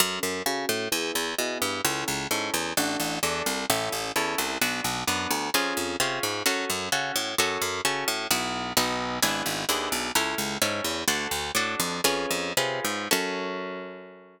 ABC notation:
X:1
M:4/4
L:1/8
Q:1/4=130
K:F#m
V:1 name="Orchestral Harp"
[CFA]2 [CFA]2 [B,EG]2 [B,EG]2 | [CEA]2 [CEA]2 [DFA]2 [DFA]2 | [CEA]2 [CEA]2 [B,DF]2 [B,DF]2 | [C^EG]2 [CEG]2 [CFA]2 [CFA]2 |
[CFA]2 [CFA]2 [B,EF]2 [B,^DF]2 | [B,DEG]2 [B,DEG]2 [CEA]2 [CEA]2 | "^rit." [DFA]2 [DFA]2 [C^EGB]2 [CEGB]2 | [CFA]8 |]
V:2 name="Harpsichord" clef=bass
F,, F,, C, A,, E,, E,, B,, =G,, | C,, C,, G,, E,, A,,, A,,, E,, =C,, | A,,, A,,, E,, =C,, B,,, B,,, F,, D,, | ^E,, E,, =C, G,, F,, F,, ^C, A,, |
F,, F,, C, A,, B,,,2 B,,,2 | G,,, G,,, ^D,, B,,, C,, C,, G,, E,, | "^rit." D,, D,, A,, ^E,, E,, E,, =C, G,, | F,,8 |]